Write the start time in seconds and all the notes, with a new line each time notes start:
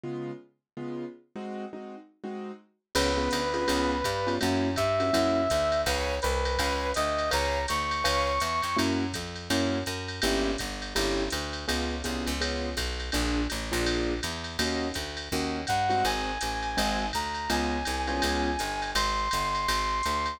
0.03 C#3 G#3 B3 F4
0.77 C#3 G#3 B3 F4
1.36 G#3 C4 D#4 F#4
1.73 G#3 C4 D#4 F#4
2.24 G#3 C4 D#4 F#4
2.95 C#2 B3 C#4 F4 G#4 B4, crash, ride
3.17 B3 C#4 F4 G#4
3.31 D2, hi-hat pedal, ride
3.54 B3 C#4 F4 G#4, ride
3.68 C#2 B3 C#4 F4 G#4, ride
4.04 G2, kick, hi-hat pedal, ride
4.27 B3 C#4 F4 G#4, ride
4.41 F#2 A#3 C#4 E4 F#4, ride
4.76 G2 E5, kick, hi-hat pedal, ride
5.00 A#3 C#4 E4 F#4, ride
5.13 F#2 A#3 C#4 E4 F#4, kick, ride
5.50 D2, kick, hi-hat pedal, ride
5.72 ride
5.86 C#2 B4 C#5 F5 G#5, kick, ride
6.22 C2 B4, hi-hat pedal, ride
6.45 ride
6.58 C#2 B4 C#5 F5 G#5, kick, ride
6.94 D2 D#5, hi-hat pedal, ride
7.18 ride
7.31 C#2 B4 C#5 F5 G#5 A#5, ride
7.68 D2 C#6, hi-hat pedal, ride
7.91 ride
8.04 C#2 B4 C#5 F5 G#5, ride
8.40 E2, hi-hat pedal, ride
8.62 F2, ride
8.77 F#2 A#3 C#4 E4 F#4, ride
9.13 F2, kick, hi-hat pedal, ride
9.36 ride
9.50 F#2 A#3 C#4 E4 F#4, ride
9.86 F#2, hi-hat pedal, ride
10.08 ride
10.22 G1 A#3 C#4 E4 G4, ride
10.58 G1, kick, hi-hat pedal, ride
10.82 ride
10.95 G1 A#3 C#4 E4 G4, ride
11.30 D2, hi-hat pedal, ride
11.53 ride
11.68 C#2 B3 C#4 F4 G#4, ride
12.04 C2 B3 C#4 F4 G#4, kick, hi-hat pedal, ride
12.27 C#2, ride
12.41 B3 C#4 F4 G#4, ride
12.77 B1, kick, hi-hat pedal, ride
13.00 ride
13.12 A#1 A#3 D4 F4 G#4, ride
13.50 A1, hi-hat pedal, ride
13.72 A#1 A#3 D4 F4 G#4, ride
13.86 ride
14.23 E2, hi-hat pedal, ride
14.44 ride
14.59 D#2 A#3 C#4 D#4 F#4, ride
14.94 D2, kick, hi-hat pedal, ride
15.17 ride
15.32 D#2 A#3 C#4 D#4 F#4, kick
15.67 G2 F#5, kick, hi-hat pedal, ride
15.89 G#3 C4 D#4 F#4, ride
16.05 G#1 G#5, ride
16.41 A1, hi-hat pedal, ride
16.62 ride
16.77 G#1 G#3 C4 D#4 F#4, ride
17.13 D2 A#5, kick, hi-hat pedal, ride
17.34 ride
17.50 C#2 G#3 B3 C#4 F4 G#5, ride
17.85 C2, hi-hat pedal, ride
18.07 G#3 B3 C#4 F4, ride
18.22 C#2, ride
18.59 G1, hi-hat pedal, ride
18.82 ride
18.95 G#1 C6, ride
19.31 G1, kick, hi-hat pedal, ride
19.55 ride
19.68 G#1, ride
20.03 D2, hi-hat pedal, ride
20.26 ride